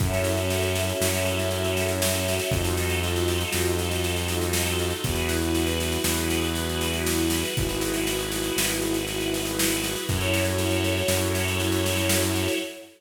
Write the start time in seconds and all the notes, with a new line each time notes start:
0.00 F#2 C#4 E4 F#4 A4 C#5 E5, kick, snare
0.13 snare
0.24 snare
0.37 snare
0.50 snare
0.63 snare
0.75 snare
0.89 snare
1.01 F#2, snare
1.15 snare
1.26 snare
1.39 snare
1.51 snare
1.64 snare
1.77 snare
1.89 snare
2.02 snare
2.15 snare
2.28 snare
2.39 snare
2.51 F2 D#4 F4 F#4 A4 D#5, kick, snare
2.64 snare
2.77 snare
2.90 snare
3.03 snare
3.16 snare
3.28 snare
3.41 snare
3.53 F2, snare
3.65 snare
3.79 snare
3.91 snare
4.04 snare
4.16 snare
4.28 snare
4.41 snare
4.53 snare
4.66 snare
4.79 snare
4.90 snare
5.03 E2 E4 F#4 G#4 B4, kick, snare
5.15 snare
5.29 snare
5.42 snare
5.55 snare
5.67 snare
5.80 snare
5.92 snare
6.04 E2, snare
6.17 snare
6.30 snare
6.44 snare
6.55 snare
6.69 snare
6.81 snare
6.93 snare
7.07 snare
7.18 snare
7.30 snare
7.45 snare
7.55 G#1 E4 F#4 G#4 B4, kick, snare
7.69 snare
7.81 snare
7.94 snare
8.07 snare
8.19 snare
8.32 snare
8.44 snare
8.57 G#1, snare
8.69 snare
8.82 snare
8.94 snare
9.07 snare
9.20 snare
9.34 snare
9.45 snare
9.59 snare
9.70 snare
9.84 snare
9.96 snare
10.08 F#2 E4 F#4 A4 C#5, kick, snare
10.21 snare
10.34 snare
10.45 snare
10.58 snare
10.71 snare
10.84 snare
10.97 snare
11.08 F#2, snare
11.22 snare
11.35 snare
11.48 snare
11.60 snare
11.72 snare
11.86 snare
11.97 snare
12.09 snare
12.22 snare
12.35 snare
12.48 snare